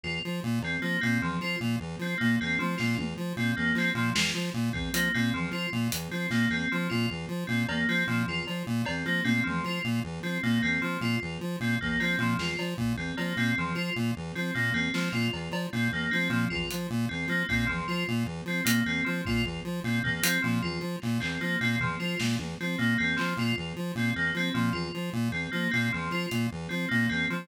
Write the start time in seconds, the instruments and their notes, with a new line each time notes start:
0.04 lead 1 (square) E2, tubular bells F4
0.25 lead 1 (square) F3
0.44 lead 1 (square) A#2
0.62 lead 1 (square) E2, tubular bells C4, cowbell
0.82 lead 1 (square) F3, tubular bells A#3
1.01 lead 1 (square) A#2, tubular bells C4
1.21 lead 1 (square) E2, tubular bells F3
1.41 lead 1 (square) F3, tubular bells F4
1.61 lead 1 (square) A#2
1.80 lead 1 (square) E2
1.99 lead 1 (square) F3, tubular bells C4
2.18 lead 1 (square) A#2, tubular bells A#3
2.41 lead 1 (square) E2, tubular bells C4
2.59 tubular bells F3, lead 1 (square) F3, high tom
2.78 lead 1 (square) A#2, tubular bells F4, snare
2.98 lead 1 (square) E2, high tom
3.17 lead 1 (square) F3
3.37 lead 1 (square) A#2, tubular bells C4
3.57 lead 1 (square) E2, tubular bells A#3
3.75 lead 1 (square) F3, tubular bells C4, clap
3.95 lead 1 (square) A#2, tubular bells F3
4.15 lead 1 (square) E2, tubular bells F4, snare
4.35 lead 1 (square) F3
4.54 lead 1 (square) A#2
4.73 lead 1 (square) E2, tubular bells C4, kick
4.93 lead 1 (square) F3, tubular bells A#3, closed hi-hat
5.14 lead 1 (square) A#2, tubular bells C4
5.34 lead 1 (square) E2, tubular bells F3
5.51 lead 1 (square) F3, tubular bells F4
5.73 lead 1 (square) A#2
5.92 lead 1 (square) E2, closed hi-hat
6.11 lead 1 (square) F3, tubular bells C4
6.30 lead 1 (square) A#2, tubular bells A#3, snare
6.50 lead 1 (square) E2, tubular bells C4
6.72 tubular bells F3, lead 1 (square) F3
6.90 lead 1 (square) A#2, tubular bells F4
7.10 lead 1 (square) E2
7.29 lead 1 (square) F3
7.47 lead 1 (square) A#2, tubular bells C4
7.69 lead 1 (square) E2, tubular bells A#3, cowbell
7.88 lead 1 (square) F3, tubular bells C4
8.07 lead 1 (square) A#2, tubular bells F3
8.27 lead 1 (square) E2, tubular bells F4
8.47 lead 1 (square) F3, cowbell
8.67 lead 1 (square) A#2
8.85 lead 1 (square) E2, tubular bells C4, cowbell
9.05 lead 1 (square) F3, tubular bells A#3
9.25 lead 1 (square) A#2, tubular bells C4, high tom
9.44 lead 1 (square) E2, tubular bells F3, high tom
9.64 lead 1 (square) F3, tubular bells F4
9.84 lead 1 (square) A#2
10.04 lead 1 (square) E2
10.23 lead 1 (square) F3, tubular bells C4
10.43 lead 1 (square) A#2, tubular bells A#3
10.63 lead 1 (square) E2, tubular bells C4
10.82 tubular bells F3, lead 1 (square) F3
11.01 lead 1 (square) A#2, tubular bells F4
11.22 lead 1 (square) E2
11.41 lead 1 (square) F3
11.60 lead 1 (square) A#2, tubular bells C4
11.80 lead 1 (square) E2, tubular bells A#3, kick
12.00 lead 1 (square) F3, tubular bells C4, cowbell
12.18 lead 1 (square) A#2, tubular bells F3
12.38 lead 1 (square) E2, tubular bells F4, snare
12.59 lead 1 (square) F3, cowbell
12.78 lead 1 (square) A#2, kick
12.97 lead 1 (square) E2, tubular bells C4
13.17 lead 1 (square) F3, tubular bells A#3, cowbell
13.37 lead 1 (square) A#2, tubular bells C4
13.57 lead 1 (square) E2, tubular bells F3
13.75 lead 1 (square) F3, tubular bells F4
13.96 lead 1 (square) A#2
14.16 lead 1 (square) E2
14.35 lead 1 (square) F3, tubular bells C4
14.55 lead 1 (square) A#2, tubular bells A#3
14.73 lead 1 (square) E2, tubular bells C4
14.94 lead 1 (square) F3, tubular bells F3, snare
15.12 lead 1 (square) A#2, tubular bells F4
15.33 lead 1 (square) E2, cowbell
15.51 lead 1 (square) F3, cowbell
15.73 lead 1 (square) A#2, tubular bells C4
15.92 lead 1 (square) E2, tubular bells A#3
16.11 lead 1 (square) F3, tubular bells C4, high tom
16.30 lead 1 (square) A#2, tubular bells F3
16.50 lead 1 (square) E2, tubular bells F4, kick
16.71 lead 1 (square) F3, closed hi-hat
16.90 lead 1 (square) A#2
17.09 lead 1 (square) E2, tubular bells C4
17.28 lead 1 (square) F3, tubular bells A#3
17.49 lead 1 (square) A#2, tubular bells C4, kick
17.67 lead 1 (square) E2, tubular bells F3
17.88 lead 1 (square) F3, tubular bells F4
18.08 lead 1 (square) A#2
18.26 lead 1 (square) E2
18.46 lead 1 (square) F3, tubular bells C4
18.65 lead 1 (square) A#2, tubular bells A#3, closed hi-hat
18.86 lead 1 (square) E2, tubular bells C4
19.05 tubular bells F3, lead 1 (square) F3
19.25 lead 1 (square) A#2, tubular bells F4, kick
19.45 lead 1 (square) E2
19.65 lead 1 (square) F3
19.84 lead 1 (square) A#2, tubular bells C4
20.04 lead 1 (square) E2, tubular bells A#3, floor tom
20.23 lead 1 (square) F3, tubular bells C4, closed hi-hat
20.42 lead 1 (square) A#2, tubular bells F3
20.63 lead 1 (square) E2, tubular bells F4
20.81 lead 1 (square) F3
21.02 lead 1 (square) A#2, clap
21.20 lead 1 (square) E2, tubular bells C4, clap
21.41 lead 1 (square) F3, tubular bells A#3
21.61 lead 1 (square) A#2, tubular bells C4
21.80 lead 1 (square) E2, tubular bells F3, floor tom
22.00 lead 1 (square) F3, tubular bells F4
22.20 lead 1 (square) A#2, snare
22.39 lead 1 (square) E2, high tom
22.60 lead 1 (square) F3, tubular bells C4
22.79 lead 1 (square) A#2, tubular bells A#3
22.98 lead 1 (square) E2, tubular bells C4
23.17 tubular bells F3, lead 1 (square) F3, clap
23.37 lead 1 (square) A#2, tubular bells F4
23.57 lead 1 (square) E2
23.76 lead 1 (square) F3
23.95 lead 1 (square) A#2, tubular bells C4
24.16 lead 1 (square) E2, tubular bells A#3
24.34 lead 1 (square) F3, tubular bells C4
24.54 lead 1 (square) A#2, tubular bells F3
24.73 lead 1 (square) E2, tubular bells F4
24.94 lead 1 (square) F3
25.13 lead 1 (square) A#2
25.32 lead 1 (square) E2, tubular bells C4
25.52 lead 1 (square) F3, tubular bells A#3
25.71 lead 1 (square) A#2, tubular bells C4
25.93 lead 1 (square) E2, tubular bells F3
26.11 lead 1 (square) F3, tubular bells F4
26.31 lead 1 (square) A#2, closed hi-hat
26.52 lead 1 (square) E2
26.69 lead 1 (square) F3, tubular bells C4
26.89 lead 1 (square) A#2, tubular bells A#3
27.09 lead 1 (square) E2, tubular bells C4
27.30 lead 1 (square) F3, tubular bells F3